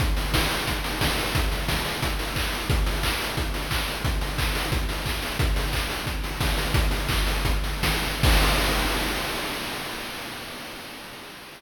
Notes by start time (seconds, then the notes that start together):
0.00 kick, closed hi-hat
0.17 open hi-hat
0.34 kick, snare
0.51 open hi-hat
0.67 kick, closed hi-hat
0.84 open hi-hat
1.01 kick, snare
1.18 open hi-hat
1.35 kick, closed hi-hat
1.52 open hi-hat
1.68 kick, snare
1.85 open hi-hat
2.02 kick, closed hi-hat
2.19 open hi-hat
2.36 kick, clap
2.53 open hi-hat
2.70 kick, closed hi-hat
2.86 open hi-hat
3.03 kick, clap
3.20 open hi-hat
3.37 kick, closed hi-hat
3.54 open hi-hat
3.71 kick, clap
3.88 open hi-hat
4.04 kick, closed hi-hat
4.21 open hi-hat
4.38 kick, clap
4.55 open hi-hat
4.72 kick, closed hi-hat
4.89 open hi-hat
5.06 kick, clap
5.22 open hi-hat
5.39 kick, closed hi-hat
5.56 open hi-hat
5.73 kick, clap
5.90 open hi-hat
6.07 kick, closed hi-hat
6.24 open hi-hat
6.41 kick, snare
6.57 open hi-hat
6.74 kick, closed hi-hat
6.91 open hi-hat
7.09 kick, clap
7.27 open hi-hat
7.45 kick, closed hi-hat
7.64 open hi-hat
7.83 kick, snare
8.03 open hi-hat
8.23 kick, crash